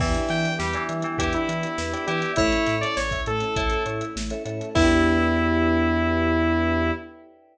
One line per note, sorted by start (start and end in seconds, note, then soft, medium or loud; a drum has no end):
0.00 0.16 E2 medium
0.00 0.51 E3 medium
0.00 2.35 B3 medium
0.00 0.13 B3 medium
0.00 2.35 D4 medium
0.00 2.35 E4 medium
0.00 2.35 G4 medium
0.00 0.48 B4 loud
0.00 0.48 D5 loud
0.00 0.48 E5 loud
0.00 0.48 G5 loud
0.00 kick loud
0.00 crash loud
0.14 0.28 D4 medium
0.14 closed hi-hat medium
0.29 0.46 E3 medium
0.29 0.43 E4 medium
0.29 0.54 G5 medium
0.29 snare medium
0.29 closed hi-hat medium
0.44 0.58 G4 medium
0.44 closed hi-hat medium
0.59 0.76 E2 medium
0.59 0.74 G3 medium
0.59 0.84 G4 medium
0.59 0.73 B4 medium
0.59 snare medium
0.73 1.04 E3 medium
0.73 0.87 D5 medium
0.73 closed hi-hat medium
0.89 1.05 E3 medium
0.89 1.03 E5 medium
0.89 closed hi-hat medium
1.02 1.18 E3 medium
1.02 1.17 G5 medium
1.02 closed hi-hat medium
1.18 1.35 E2 medium
1.18 1.32 B3 medium
1.18 2.06 E4 medium
1.18 1.32 G4 medium
1.18 1.66 B4 medium
1.18 1.66 D5 medium
1.18 1.66 E5 medium
1.18 1.66 G5 medium
1.18 kick medium
1.18 closed hi-hat loud
1.33 1.47 D4 medium
1.33 2.06 E4 medium
1.33 closed hi-hat medium
1.49 1.65 E3 medium
1.49 1.62 E4 medium
1.49 closed hi-hat medium
1.63 1.77 G4 medium
1.63 closed hi-hat medium
1.78 1.95 E2 medium
1.78 1.92 B4 medium
1.78 snare medium
1.93 2.05 B4 medium
1.93 2.06 D5 medium
1.93 2.05 D5 medium
1.93 2.05 E5 medium
1.93 2.05 G5 medium
1.93 closed hi-hat medium
2.07 2.24 E3 medium
2.07 2.37 E4 medium
2.07 2.31 G4 medium
2.07 2.32 B4 medium
2.07 2.32 D5 medium
2.07 2.21 E5 medium
2.07 2.32 E5 medium
2.07 2.32 G5 medium
2.07 closed hi-hat medium
2.22 2.36 G5 medium
2.22 closed hi-hat medium
2.36 2.54 A1 medium
2.36 4.72 A3 medium
2.36 2.51 A3 medium
2.36 4.72 C#4 medium
2.36 2.75 E4 medium
2.36 4.72 E4 medium
2.36 2.85 A4 loud
2.36 2.85 C#5 loud
2.36 2.87 C#5 medium
2.36 2.85 E5 loud
2.36 kick loud
2.36 closed hi-hat medium
2.52 2.66 C#4 medium
2.52 closed hi-hat medium
2.66 2.84 A2 medium
2.66 2.81 E4 medium
2.66 snare medium
2.66 closed hi-hat medium
2.81 2.96 A4 medium
2.81 2.95 D5 medium
2.81 closed hi-hat medium
2.97 3.13 A1 medium
2.97 3.21 C#5 medium
2.97 3.11 C#5 medium
2.97 snare loud
3.11 3.25 E5 medium
3.11 kick medium
3.11 closed hi-hat medium
3.26 3.43 A2 medium
3.26 3.40 A3 medium
3.26 3.83 A4 medium
3.26 closed hi-hat medium
3.40 3.55 C#4 medium
3.40 closed hi-hat medium
3.56 3.73 A1 medium
3.56 4.04 E4 medium
3.56 3.70 E4 medium
3.56 4.04 A4 medium
3.56 4.04 C#5 medium
3.56 4.04 E5 medium
3.56 kick loud
3.56 closed hi-hat medium
3.70 3.85 A4 medium
3.70 closed hi-hat medium
3.86 4.02 A2 medium
3.86 3.99 C#5 medium
3.86 closed hi-hat medium
4.01 4.14 E5 medium
4.01 closed hi-hat medium
4.16 4.32 A1 medium
4.16 4.29 A3 medium
4.16 snare loud
4.30 4.44 C#4 medium
4.30 4.43 A4 medium
4.30 4.43 C#5 medium
4.30 4.43 E5 medium
4.30 closed hi-hat medium
4.45 4.62 A2 medium
4.45 4.59 E4 medium
4.45 4.69 A4 medium
4.45 4.69 C#5 loud
4.45 4.69 E5 medium
4.45 closed hi-hat medium
4.61 4.74 A4 medium
4.61 closed hi-hat medium
4.75 6.91 E2 loud
4.75 6.91 B3 loud
4.75 6.92 B3 loud
4.75 6.92 D4 loud
4.75 6.91 D4 loud
4.75 6.91 E4 loud
4.75 6.92 E4 medium
4.75 6.92 G4 medium
4.75 6.91 B4 medium
4.75 6.91 D5 loud
4.75 6.91 E5 loud
4.75 6.91 G5 loud
4.75 kick loud
4.75 crash loud
4.81 6.91 E4 medium
4.81 6.91 G4 loud